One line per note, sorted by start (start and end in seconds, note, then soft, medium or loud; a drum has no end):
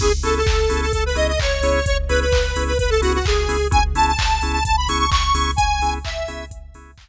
0.00 0.20 C#2 medium
0.00 0.09 B3 medium
0.00 0.09 C#4 medium
0.00 0.09 E4 medium
0.00 0.09 G#4 medium
0.00 0.12 G#4 loud
0.00 kick loud
0.00 crash loud
0.23 0.44 C#2 medium
0.23 0.39 B3 medium
0.23 0.39 C#4 medium
0.23 0.39 E4 medium
0.23 0.39 G#4 medium
0.23 0.34 A4 loud
0.23 open hi-hat medium
0.37 0.81 A4 loud
0.46 0.66 C#2 medium
0.46 kick loud
0.46 clap loud
0.69 0.91 C#2 medium
0.69 0.86 B3 medium
0.69 0.86 C#4 medium
0.69 0.86 E4 medium
0.69 0.86 G#4 medium
0.69 open hi-hat medium
0.81 0.92 A4 loud
0.93 1.14 C#2 medium
0.93 1.04 A4 loud
0.93 kick loud
0.93 closed hi-hat loud
1.06 1.17 B4 loud
1.15 1.36 C#2 medium
1.15 1.32 B3 medium
1.15 1.32 C#4 medium
1.15 1.32 E4 medium
1.15 1.32 G#4 medium
1.15 1.27 D#5 loud
1.15 open hi-hat medium
1.28 1.39 D#5 loud
1.39 1.59 C#2 medium
1.39 1.85 C#5 loud
1.39 kick loud
1.39 clap loud
1.61 1.81 C#2 medium
1.61 1.79 B3 medium
1.61 1.79 C#4 medium
1.61 1.79 E4 medium
1.61 1.79 G#4 medium
1.61 open hi-hat loud
1.86 2.06 C#2 medium
1.86 1.98 C#5 loud
1.86 kick loud
1.86 closed hi-hat loud
2.09 2.29 C#2 medium
2.09 2.25 B3 medium
2.09 2.25 C#4 medium
2.09 2.25 E4 medium
2.09 2.25 G#4 medium
2.09 2.20 B4 loud
2.09 open hi-hat medium
2.21 2.64 B4 medium
2.32 2.52 C#2 medium
2.32 kick loud
2.32 clap loud
2.56 2.76 C#2 medium
2.56 2.73 B3 medium
2.56 2.73 C#4 medium
2.56 2.73 E4 medium
2.56 2.73 G#4 medium
2.56 open hi-hat medium
2.67 2.78 B4 medium
2.79 3.00 C#2 medium
2.79 2.90 B4 loud
2.79 kick loud
2.79 closed hi-hat loud
2.90 3.01 A4 loud
3.02 3.21 C#2 medium
3.02 3.18 B3 medium
3.02 3.18 C#4 medium
3.02 3.18 E4 medium
3.02 3.13 F#4 loud
3.02 3.18 G#4 medium
3.02 open hi-hat loud
3.14 3.25 F#4 medium
3.25 3.46 C#2 medium
3.25 3.68 G#4 loud
3.25 kick loud
3.25 clap loud
3.48 3.67 C#2 medium
3.48 3.57 B3 medium
3.48 3.57 C#4 medium
3.48 3.57 E4 medium
3.48 3.57 G#4 medium
3.48 open hi-hat loud
3.71 3.94 C#2 medium
3.71 3.79 B3 medium
3.71 3.79 C#4 medium
3.71 3.79 E4 medium
3.71 3.79 G#4 medium
3.71 3.83 G#5 loud
3.71 kick loud
3.71 closed hi-hat loud
3.94 4.14 C#2 medium
3.94 4.12 B3 medium
3.94 4.12 C#4 medium
3.94 4.12 E4 medium
3.94 4.12 G#4 medium
3.94 4.06 A5 loud
3.94 open hi-hat loud
4.07 4.52 A5 loud
4.19 4.39 C#2 medium
4.19 kick loud
4.19 clap loud
4.42 4.62 C#2 medium
4.42 4.59 B3 medium
4.42 4.59 C#4 medium
4.42 4.59 E4 medium
4.42 4.59 G#4 medium
4.42 open hi-hat medium
4.53 4.64 A5 loud
4.65 4.86 C#2 medium
4.65 4.76 A5 loud
4.65 kick loud
4.65 closed hi-hat loud
4.77 4.88 B5 loud
4.88 5.08 C#2 medium
4.88 5.05 B3 medium
4.88 5.05 C#4 medium
4.88 5.05 E4 medium
4.88 5.05 G#4 medium
4.88 4.98 C#6 loud
4.88 open hi-hat loud
4.99 5.10 C#6 loud
5.11 5.31 C#2 medium
5.11 5.51 C#6 loud
5.11 kick loud
5.11 clap loud
5.34 5.54 C#2 medium
5.34 5.51 B3 medium
5.34 5.51 C#4 medium
5.34 5.51 E4 medium
5.34 5.51 G#4 medium
5.34 open hi-hat loud
5.56 5.79 C#2 medium
5.56 5.94 G#5 loud
5.56 kick loud
5.56 closed hi-hat loud
5.80 5.99 C#2 medium
5.80 5.98 B3 medium
5.80 5.98 C#4 medium
5.80 5.98 E4 medium
5.80 5.98 G#4 medium
5.80 open hi-hat medium
6.05 6.25 C#2 medium
6.05 6.45 E5 loud
6.05 kick medium
6.05 clap loud
6.28 6.47 C#2 medium
6.28 6.44 B3 medium
6.28 6.44 C#4 medium
6.28 6.44 E4 medium
6.28 6.44 G#4 medium
6.28 open hi-hat medium
6.50 6.70 C#2 medium
6.50 kick loud
6.50 closed hi-hat loud
6.74 6.94 C#2 medium
6.74 6.91 B3 medium
6.74 6.91 C#4 medium
6.74 6.91 E4 medium
6.74 6.91 G#4 medium
6.74 open hi-hat medium
6.98 7.09 C#2 medium
6.98 kick loud
6.98 clap loud